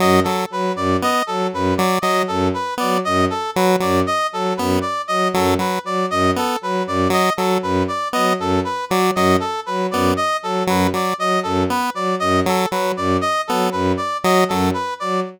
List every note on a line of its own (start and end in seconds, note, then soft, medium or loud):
0.00 0.21 F#2 medium
0.00 0.20 F#3 medium
0.00 0.20 D#5 medium
0.24 0.46 F#3 medium
0.24 0.44 A4 medium
0.50 0.71 F#3 medium
0.50 0.72 B4 medium
0.75 0.96 F#2 medium
0.75 0.97 D5 medium
1.02 1.23 B3 medium
1.02 1.23 D#5 medium
1.27 1.47 F#3 medium
1.27 1.47 A4 medium
1.53 1.73 F#2 medium
1.53 1.74 B4 medium
1.77 1.99 F#3 medium
1.77 1.98 D5 medium
2.02 2.23 F#3 medium
2.02 2.24 F#3 medium
2.02 2.22 D#5 medium
2.28 2.49 F#2 medium
2.28 2.48 A4 medium
2.54 2.74 B4 medium
2.78 3.00 F#3 medium
2.78 2.98 B3 medium
2.78 2.99 D5 medium
3.05 3.26 F#2 medium
3.05 3.25 D#5 medium
3.30 3.50 A4 medium
3.56 3.76 F#3 medium
3.56 3.76 B4 medium
3.80 4.02 F#2 medium
3.80 4.00 F#3 medium
3.80 4.01 D5 medium
4.07 4.27 D#5 medium
4.32 4.52 F#3 medium
4.32 4.53 A4 medium
4.57 4.78 F#2 medium
4.57 4.79 B3 medium
4.57 4.77 B4 medium
4.81 5.02 D5 medium
5.08 5.28 F#3 medium
5.08 5.28 D#5 medium
5.34 5.55 F#2 medium
5.34 5.55 F#3 medium
5.34 5.54 A4 medium
5.59 5.79 F#3 medium
5.59 5.79 B4 medium
5.84 6.04 F#3 medium
5.84 6.06 D5 medium
6.10 6.31 F#2 medium
6.10 6.31 D#5 medium
6.36 6.57 B3 medium
6.36 6.58 A4 medium
6.61 6.82 F#3 medium
6.61 6.83 B4 medium
6.87 7.07 F#2 medium
6.87 7.08 D5 medium
7.10 7.30 F#3 medium
7.10 7.33 D#5 medium
7.37 7.58 F#3 medium
7.37 7.58 A4 medium
7.62 7.83 F#2 medium
7.62 7.83 B4 medium
7.88 8.08 D5 medium
8.13 8.34 F#3 medium
8.13 8.33 B3 medium
8.13 8.33 D#5 medium
8.39 8.59 F#2 medium
8.39 8.60 A4 medium
8.65 8.85 B4 medium
8.90 9.10 F#3 medium
8.90 9.11 F#3 medium
8.90 9.10 D5 medium
9.15 9.36 F#2 medium
9.15 9.37 F#3 medium
9.15 9.36 D#5 medium
9.40 9.60 A4 medium
9.66 9.87 F#3 medium
9.66 9.86 B4 medium
9.91 10.12 F#2 medium
9.91 10.14 B3 medium
9.91 10.11 D5 medium
10.17 10.37 D#5 medium
10.42 10.63 F#3 medium
10.42 10.63 A4 medium
10.67 10.88 F#2 medium
10.67 10.88 F#3 medium
10.67 10.89 B4 medium
10.94 11.14 F#3 medium
10.94 11.15 D5 medium
11.18 11.38 F#3 medium
11.18 11.40 D#5 medium
11.43 11.64 F#2 medium
11.43 11.63 A4 medium
11.70 11.90 B3 medium
11.70 11.90 B4 medium
11.94 12.14 F#3 medium
11.94 12.15 D5 medium
12.20 12.41 F#2 medium
12.20 12.40 D#5 medium
12.46 12.66 F#3 medium
12.46 12.68 A4 medium
12.71 12.92 F#3 medium
12.71 12.92 B4 medium
12.97 13.17 F#2 medium
12.97 13.17 D5 medium
13.21 13.41 D#5 medium
13.47 13.68 F#3 medium
13.47 13.70 B3 medium
13.47 13.68 A4 medium
13.72 13.93 F#2 medium
13.72 13.92 B4 medium
13.97 14.17 D5 medium
14.24 14.44 F#3 medium
14.24 14.44 D#5 medium
14.49 14.70 F#2 medium
14.49 14.71 F#3 medium
14.49 14.69 A4 medium
14.74 14.94 B4 medium
15.00 15.21 F#3 medium
15.00 15.20 D5 medium